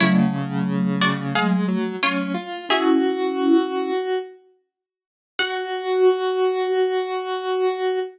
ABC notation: X:1
M:4/4
L:1/8
Q:1/4=89
K:F#m
V:1 name="Pizzicato Strings"
[Ec]3 [Fd] [G^e]2 [^Ec]2 | [Ge]4 z4 | f8 |]
V:2 name="Vibraphone"
[F,A,]8 | [CE]4 z4 | F8 |]
V:3 name="Lead 1 (square)"
C,4 G, F, C ^E | F5 z3 | F8 |]